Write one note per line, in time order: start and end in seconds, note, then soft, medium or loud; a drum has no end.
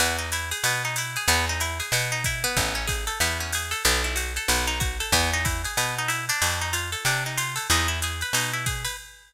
0.00 0.53 E2 loud
0.00 0.17 B3 medium
0.00 ride medium
0.19 0.30 D#4 medium
0.32 0.50 E4 medium
0.32 hi-hat pedal medium
0.32 ride medium
0.51 0.63 G#4 medium
0.51 ride medium
0.64 1.17 B2 medium
0.64 0.83 B3 medium
0.64 ride medium
0.85 0.96 D#4 medium
0.96 1.15 E4 medium
0.96 hi-hat pedal medium
0.96 ride medium
1.16 1.28 G#4 medium
1.16 ride medium
1.28 1.81 E2 loud
1.28 1.45 B3 loud
1.28 ride medium
1.49 1.61 D#4 medium
1.60 1.78 E4 medium
1.60 hi-hat pedal medium
1.60 ride medium
1.80 1.92 G#4 medium
1.80 ride medium
1.92 2.46 B2 loud
1.92 2.11 B3 medium
1.92 ride medium
2.12 2.24 D#4 medium
2.24 2.43 E4 medium
2.24 kick medium
2.24 hi-hat pedal medium
2.24 ride medium
2.44 2.74 B3 loud
2.44 ride medium
2.57 3.10 A1 loud
2.57 kick medium
2.57 ride medium
2.75 2.87 C#4 medium
2.87 3.05 G#4 medium
2.87 kick medium
2.87 hi-hat pedal medium
2.87 ride medium
3.07 3.19 A4 medium
3.07 ride medium
3.20 3.74 E2 loud
3.20 3.38 B3 medium
3.20 ride medium
3.40 3.52 C#4 medium
3.52 3.72 G#4 medium
3.52 hi-hat pedal medium
3.52 ride medium
3.71 3.83 A4 medium
3.71 ride medium
3.85 4.39 B1 loud
3.85 4.02 B3 medium
3.85 ride medium
4.04 4.16 E4 medium
4.16 4.33 F#4 medium
4.16 hi-hat pedal medium
4.16 ride medium
4.36 4.48 A4 medium
4.36 ride medium
4.48 5.02 B1 loud
4.48 4.66 B3 medium
4.48 ride medium
4.67 4.79 D#4 medium
4.80 4.97 F#4 medium
4.80 kick medium
4.80 hi-hat pedal medium
4.80 ride medium
5.00 5.12 A4 medium
5.00 ride medium
5.12 5.66 E2 loud
5.12 5.30 B3 medium
5.12 kick soft
5.12 ride medium
5.33 5.45 D#4 medium
5.45 5.62 E4 medium
5.45 kick medium
5.45 hi-hat pedal medium
5.45 ride medium
5.64 5.77 G#4 medium
5.64 ride medium
5.77 6.31 B2 medium
5.77 5.95 B3 medium
5.77 ride medium
5.98 6.10 D#4 medium
6.08 6.25 E4 medium
6.08 hi-hat pedal medium
6.08 ride medium
6.29 6.60 D4 medium
6.29 ride medium
6.42 6.95 F2 loud
6.42 ride medium
6.61 6.73 D#4 medium
6.73 6.90 F4 medium
6.73 hi-hat pedal medium
6.73 ride medium
6.92 7.04 A4 medium
6.92 ride medium
7.05 7.59 C3 loud
7.05 7.23 D4 medium
7.05 ride medium
7.26 7.38 D#4 medium
7.38 7.55 F4 medium
7.38 hi-hat pedal medium
7.38 ride medium
7.56 7.67 A4 medium
7.56 ride medium
7.70 8.23 E2 loud
7.70 7.88 D#4 medium
7.70 ride medium
7.88 8.00 E4 medium
8.02 8.21 G#4 medium
8.02 hi-hat pedal medium
8.02 ride medium
8.21 8.34 B4 medium
8.21 ride medium
8.33 8.87 B2 medium
8.33 8.52 D#4 medium
8.33 ride loud
8.53 8.65 E4 medium
8.66 8.83 G#4 medium
8.66 kick medium
8.66 hi-hat pedal medium
8.66 ride medium
8.85 8.96 B4 medium
8.85 ride medium